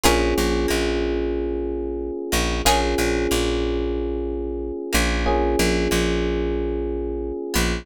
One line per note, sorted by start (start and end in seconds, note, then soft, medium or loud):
0.04 0.34 A#1 medium
0.04 2.61 A#3 medium
0.04 2.61 C#4 medium
0.04 0.18 F4 medium
0.04 2.61 F4 medium
0.04 2.61 G#4 medium
0.04 0.18 G#4 loud
0.04 0.18 A#4 loud
0.04 0.18 C#5 loud
0.38 0.67 A#1 medium
0.38 0.67 A#3 medium
0.68 2.11 A#1 medium
0.68 2.09 A#3 medium
2.32 2.62 A#1 medium
2.32 2.61 A#3 medium
2.65 2.95 A#1 medium
2.65 5.22 A#3 medium
2.65 5.22 C#4 medium
2.65 5.22 F4 medium
2.65 2.80 F4 loud
2.65 5.22 G#4 medium
2.65 2.80 G#4 loud
2.65 2.80 A#4 loud
2.65 2.80 C#5 loud
2.98 3.27 A#1 medium
2.98 3.27 A#3 medium
3.31 4.72 A#1 medium
3.31 4.71 A#3 medium
4.93 5.56 A#1 medium
4.93 5.54 A#3 medium
5.26 7.83 A#3 medium
5.26 7.83 C#4 medium
5.26 7.83 F4 medium
5.26 7.83 G#4 medium
5.59 5.88 A#1 medium
5.59 5.88 A#3 medium
5.91 7.32 A#1 medium
5.91 7.32 A#3 medium
7.54 7.84 A#1 medium
7.54 7.83 B3 medium